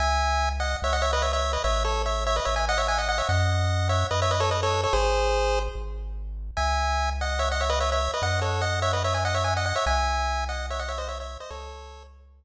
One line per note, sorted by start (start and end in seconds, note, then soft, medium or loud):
0.00 0.76 C#2 medium
0.00 0.49 E5 medium
0.00 0.49 G#5 medium
0.60 0.77 D#5 medium
0.60 0.77 F#5 medium
0.82 1.58 C#2 medium
0.82 0.93 C#5 medium
0.82 0.93 E5 medium
0.93 1.02 D#5 medium
0.93 1.02 F#5 medium
1.02 1.11 C#5 medium
1.02 1.11 E5 medium
1.13 1.23 B4 medium
1.13 1.23 D#5 medium
1.22 1.32 C#5 medium
1.22 1.32 E5 medium
1.33 1.52 C#5 medium
1.33 1.52 E5 medium
1.53 1.63 B4 medium
1.53 1.63 D#5 medium
1.64 2.40 A1 medium
1.64 1.83 C#5 medium
1.64 1.83 E5 medium
1.85 2.02 A4 medium
1.85 2.02 C#5 medium
2.06 2.24 C#5 medium
2.06 2.24 E5 medium
2.27 2.36 C#5 medium
2.27 2.36 E5 medium
2.36 2.46 B4 medium
2.36 2.46 D#5 medium
2.45 3.22 A1 medium
2.45 2.55 C#5 medium
2.45 2.55 E5 medium
2.56 2.66 E5 medium
2.56 2.66 G#5 medium
2.69 2.78 D#5 medium
2.69 2.78 F#5 medium
2.78 2.87 C#5 medium
2.78 2.87 E5 medium
2.88 2.98 E5 medium
2.88 2.98 G#5 medium
2.98 3.08 D#5 medium
2.98 3.08 F#5 medium
3.09 3.18 D#5 medium
3.09 3.18 F#5 medium
3.18 3.28 C#5 medium
3.18 3.28 E5 medium
3.29 4.04 F#2 loud
3.29 3.88 D#5 medium
3.29 3.88 F#5 medium
3.89 4.07 C#5 medium
3.89 4.07 E5 medium
4.11 4.87 F#2 medium
4.11 4.20 B4 medium
4.11 4.20 D#5 medium
4.22 4.32 C#5 medium
4.22 4.32 E5 medium
4.31 4.41 B4 medium
4.31 4.41 D#5 medium
4.40 4.50 A4 medium
4.40 4.50 C#5 medium
4.51 4.61 B4 medium
4.51 4.61 D#5 medium
4.63 4.81 A4 medium
4.63 4.81 C#5 medium
4.84 4.93 A4 medium
4.84 4.93 C#5 medium
4.93 5.69 G#1 loud
4.93 5.59 G#4 medium
4.93 5.59 C5 medium
5.75 6.51 G#1 medium
6.57 8.09 C#2 medium
6.57 7.10 E5 medium
6.57 7.10 G#5 medium
7.21 7.40 D#5 medium
7.21 7.40 F#5 medium
7.39 7.49 C#5 medium
7.39 7.49 E5 medium
7.52 7.61 D#5 medium
7.52 7.61 F#5 medium
7.61 7.70 C#5 medium
7.61 7.70 E5 medium
7.70 7.79 B4 medium
7.70 7.79 D#5 medium
7.80 7.90 C#5 medium
7.80 7.90 E5 medium
7.92 8.11 C#5 medium
7.92 8.11 E5 medium
8.14 8.23 B4 medium
8.14 8.22 D#5 medium
8.22 9.73 F#2 medium
8.22 8.40 D#5 medium
8.22 8.40 F#5 medium
8.42 8.61 A4 soft
8.42 8.61 C#5 medium
8.61 8.80 D#5 medium
8.61 8.80 F#5 medium
8.82 8.92 C#5 medium
8.82 8.92 E5 medium
8.93 9.03 B4 medium
8.93 9.03 D#5 medium
9.04 9.14 C#5 medium
9.04 9.14 E5 medium
9.14 9.24 E5 soft
9.14 9.24 G#5 medium
9.25 9.35 D#5 medium
9.25 9.35 F#5 medium
9.35 9.44 C#5 medium
9.35 9.44 E5 medium
9.44 9.54 E5 medium
9.44 9.54 G#5 medium
9.57 9.65 D#5 medium
9.57 9.65 F#5 medium
9.66 9.75 D#5 medium
9.66 9.75 F#5 medium
9.76 9.85 C#5 medium
9.76 9.85 E5 medium
9.86 11.38 C2 medium
9.86 10.45 E5 medium
9.86 10.45 G#5 medium
10.49 10.66 D#5 medium
10.49 10.66 F#5 medium
10.70 10.80 C#5 medium
10.70 10.80 E5 medium
10.79 10.89 D#5 medium
10.79 10.89 F#5 medium
10.88 10.98 C#5 medium
10.88 10.98 E5 medium
10.98 11.08 C5 medium
10.98 11.08 D#5 medium
11.08 11.18 C#5 medium
11.08 11.18 E5 medium
11.20 11.38 C#5 soft
11.20 11.38 E5 medium
11.40 11.50 C5 medium
11.40 11.50 D#5 medium
11.50 12.44 C#2 medium
11.50 12.03 A4 medium
11.50 12.03 C#5 medium